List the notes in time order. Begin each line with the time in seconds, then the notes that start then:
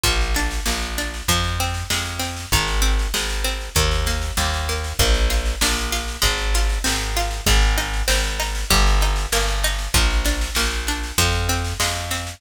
0.03 A#1 F3, kick, snare
0.21 snare
0.35 D4, snare
0.51 snare
0.66 A#1 A#3, snare
0.82 snare
0.98 D4, snare
1.14 snare
1.28 F2 F3, kick, snare
1.44 snare
1.60 C4, snare
1.74 snare
1.90 F2 G#3, snare
2.06 snare
2.19 C4, snare
2.36 snare
2.52 G#1 D#3, kick, snare
2.67 snare
2.82 C4, snare
2.99 snare
3.14 G#1 G#3, snare
3.30 snare
3.44 C4, snare
3.61 snare
3.75 D#2 D#3, kick, snare
3.91 snare
4.06 A#3, snare
4.22 snare
4.37 D#2 G3, snare
4.53 snare
4.69 A#3, snare
4.84 snare
4.99 A#1 A#3, kick, snare
5.14 snare
5.30 F4, snare
5.45 snare
5.61 A#1 D4, snare
5.77 snare
5.92 F4, snare
6.08 snare
6.22 G#1 G#3, kick, snare
6.38 snare
6.54 F4, snare
6.69 snare
6.84 G#1 C4, snare
7.00 snare
7.16 F4, snare
7.31 snare
7.46 G#1 G#3, kick, snare
7.62 snare
7.78 D#4, snare
7.94 snare
8.08 G#1 C4, snare
8.24 snare
8.40 D#4, snare
8.55 snare
8.70 G1 G3, kick, snare
8.87 snare
9.01 D#4, snare
9.16 snare
9.32 G1 A#3, snare
9.48 snare
9.64 D#4, snare
9.79 snare
9.94 A#1 F3, kick, snare
10.10 snare
10.25 D4, snare
10.41 snare
10.55 A#1 A#3, snare
10.71 snare
10.87 D4, snare
11.03 snare
11.18 F2 F3, kick, snare
11.32 snare
11.49 C4, snare
11.65 snare
11.80 F2 G#3, snare
11.96 snare
12.11 C4, snare
12.27 snare